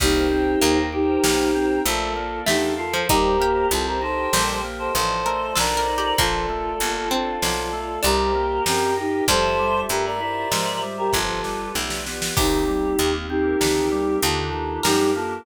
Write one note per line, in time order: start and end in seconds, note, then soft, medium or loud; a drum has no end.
0.00 0.56 C2 loud
0.00 0.28 A#3 medium
0.00 0.78 D#4 medium
0.00 0.78 G4 loud
0.00 0.92 A#4 medium
0.00 0.92 C5 medium
0.00 0.92 D#5 medium
0.00 0.92 G5 medium
0.00 kick loud
0.00 crash medium
0.31 0.59 C4 medium
0.61 1.18 D#2 medium
0.61 1.18 A#3 medium
0.61 0.90 D#4 medium
0.61 closed hi-hat loud
0.93 1.79 D#4 medium
0.93 1.20 G4 medium
0.93 1.79 G4 loud
0.93 1.84 A#4 medium
0.93 1.85 C5 medium
0.93 1.85 G5 medium
0.93 1.85 A#5 medium
1.23 1.79 B1 medium
1.23 1.51 A#3 medium
1.23 snare loud
1.55 1.83 C4 medium
1.85 2.41 A#1 medium
1.85 2.13 A3 loud
1.85 2.39 F4 medium
1.85 2.46 A4 medium
1.85 2.39 A4 medium
1.85 2.46 A#4 medium
1.85 2.46 D5 medium
1.85 2.46 F5 medium
1.85 closed hi-hat loud
2.16 2.44 A#3 medium
2.46 3.03 E2 medium
2.46 2.87 A3 medium
2.46 2.75 D4 medium
2.46 2.72 D#4 medium
2.46 2.72 G4 medium
2.46 3.07 A4 medium
2.46 3.07 A#4 medium
2.46 3.07 F5 medium
2.46 3.07 A5 medium
2.46 snare loud
2.78 3.04 F4 medium
2.78 3.06 F4 medium
2.78 3.04 A4 medium
2.93 3.08 F3 medium
3.09 3.65 D#2 medium
3.09 3.37 G3 loud
3.09 3.36 D#4 medium
3.09 4.01 G4 medium
3.09 3.66 G4 medium
3.09 4.01 A#4 medium
3.09 3.66 A#4 loud
3.09 4.01 C5 medium
3.09 4.01 D#5 medium
3.09 kick loud
3.09 closed hi-hat loud
3.40 3.68 A#3 medium
3.40 4.25 G4 medium
3.71 4.27 C2 medium
3.71 3.99 C4 medium
3.71 3.87 F4 medium
3.71 3.87 A4 loud
3.71 closed hi-hat loud
3.87 4.01 G4 medium
3.87 4.01 A#4 medium
4.02 4.30 D#4 medium
4.02 4.95 G4 medium
4.02 4.58 A4 medium
4.02 4.95 A#4 medium
4.02 4.58 C5 medium
4.02 4.93 D#5 medium
4.02 4.95 G5 medium
4.33 4.89 A#1 medium
4.33 4.61 G3 medium
4.33 4.60 C5 medium
4.33 snare loud
4.64 4.92 A#3 medium
4.79 4.93 A4 medium
4.79 4.93 C5 medium
4.94 5.51 A1 medium
4.94 5.23 F3 medium
4.94 5.55 F4 medium
4.94 5.55 A4 medium
4.94 5.54 A4 medium
4.94 5.54 C5 medium
4.94 5.55 D5 medium
4.94 5.55 D#5 medium
4.94 closed hi-hat loud
5.26 5.54 A3 medium
5.26 5.51 A#4 medium
5.56 6.13 B1 medium
5.56 5.85 D4 medium
5.56 6.18 F4 medium
5.56 5.75 A4 medium
5.56 6.18 A4 medium
5.56 6.18 A#4 medium
5.56 6.18 C5 medium
5.56 6.18 D5 loud
5.56 6.18 D#5 medium
5.56 snare loud
5.77 5.97 A#4 medium
5.88 6.15 D#4 medium
5.98 6.18 G4 medium
6.18 6.74 A#1 medium
6.18 6.46 F3 loud
6.18 7.06 A#3 medium
6.18 7.09 F4 medium
6.18 7.11 F4 medium
6.18 7.09 A4 loud
6.18 7.11 A4 medium
6.18 7.11 A#4 medium
6.18 7.11 D5 medium
6.18 kick loud
6.18 closed hi-hat loud
6.49 6.77 A3 medium
6.80 7.36 G1 medium
6.80 7.08 A#3 medium
6.80 closed hi-hat loud
7.11 7.90 C4 medium
7.11 7.39 D4 medium
7.11 8.04 F4 medium
7.11 8.00 F4 medium
7.11 8.04 A4 medium
7.11 8.00 A4 medium
7.11 8.04 D5 medium
7.11 8.04 F5 medium
7.42 7.98 B1 medium
7.42 7.70 F3 medium
7.42 snare loud
7.73 8.01 A3 medium
8.03 8.60 C2 medium
8.03 8.32 G3 medium
8.03 9.02 D4 medium
8.03 8.63 G4 medium
8.03 8.65 G4 medium
8.03 8.63 A#4 medium
8.03 8.65 A#4 medium
8.03 8.66 C5 medium
8.03 8.65 D#5 medium
8.03 closed hi-hat loud
8.35 8.63 A#3 medium
8.65 9.22 F#2 medium
8.65 8.94 C4 medium
8.65 9.26 G4 medium
8.65 8.95 G4 medium
8.65 9.26 A#4 medium
8.65 8.95 A#4 medium
8.65 9.26 D#5 medium
8.65 9.26 G5 medium
8.65 snare loud
8.97 9.25 D#4 medium
8.97 9.24 D#4 medium
8.97 9.24 G4 medium
9.28 9.84 F2 loud
9.28 9.56 F3 loud
9.28 11.40 G3 medium
9.28 10.20 F4 medium
9.28 10.20 G4 medium
9.28 10.20 A4 medium
9.28 9.80 A4 loud
9.28 9.80 C5 loud
9.28 10.20 E5 medium
9.28 kick loud
9.28 closed hi-hat loud
9.59 9.87 G3 medium
9.89 10.45 G2 medium
9.89 10.17 A3 medium
9.89 10.04 G4 medium
9.89 10.04 A#4 medium
9.89 closed hi-hat loud
10.05 10.20 A#4 medium
10.05 10.20 D5 medium
10.20 10.48 E4 medium
10.20 11.13 F4 medium
10.20 11.13 G4 medium
10.20 10.80 A#4 medium
10.20 11.13 C5 medium
10.20 10.80 D5 medium
10.20 11.13 E5 medium
10.52 11.07 G#2 medium
10.52 10.79 F3 medium
10.52 snare loud
10.82 11.10 G3 medium
10.98 11.12 G4 medium
10.98 11.12 A#4 medium
11.13 11.69 G1 medium
11.13 11.41 F3 medium
11.13 11.69 F4 medium
11.13 11.73 F4 medium
11.13 11.73 G4 medium
11.13 11.69 A4 medium
11.13 11.75 A4 medium
11.13 11.73 B4 medium
11.13 kick medium
11.13 snare medium
11.44 11.72 G3 medium
11.44 snare medium
11.74 12.31 B1 medium
11.74 12.03 A3 medium
11.74 12.35 F4 medium
11.74 12.35 G4 medium
11.74 12.35 B4 medium
11.74 12.35 D5 medium
11.74 snare medium
11.90 snare loud
12.06 12.34 B3 medium
12.06 snare medium
12.22 snare loud
12.36 12.93 C2 medium
12.36 12.64 D#3 medium
12.36 13.28 A#3 medium
12.36 13.28 C4 medium
12.36 13.28 D#4 medium
12.36 13.12 D#4 medium
12.36 13.28 G4 medium
12.36 14.74 G4 medium
12.36 13.12 G4 loud
12.36 kick loud
12.36 crash loud
12.68 12.96 G3 medium
12.99 13.55 D#2 medium
12.99 13.27 A#3 medium
12.99 closed hi-hat loud
13.29 14.21 A#3 medium
13.29 14.21 C4 medium
13.29 13.58 C4 medium
13.29 14.16 D#4 medium
13.29 14.16 G4 medium
13.29 14.21 G4 medium
13.29 14.21 A#4 medium
13.61 14.16 D2 medium
13.61 13.89 D#3 medium
13.61 snare loud
13.92 14.19 G3 medium
14.22 14.78 D#2 medium
14.22 14.51 D3 medium
14.22 14.84 A#3 medium
14.22 14.84 D4 medium
14.22 14.84 D#4 medium
14.22 14.80 F4 medium
14.22 14.84 G4 medium
14.22 14.80 A4 medium
14.22 closed hi-hat loud
14.53 14.81 D#3 medium
14.83 15.40 F#2 medium
14.83 15.12 G3 medium
14.83 15.45 A#3 medium
14.83 15.45 D4 medium
14.83 15.11 D#4 medium
14.83 15.11 G4 medium
14.83 15.45 G4 medium
14.83 15.35 A#4 medium
14.83 15.45 A#4 medium
14.83 snare loud
15.15 15.43 A#3 medium
15.15 15.42 F4 medium
15.15 15.42 A4 medium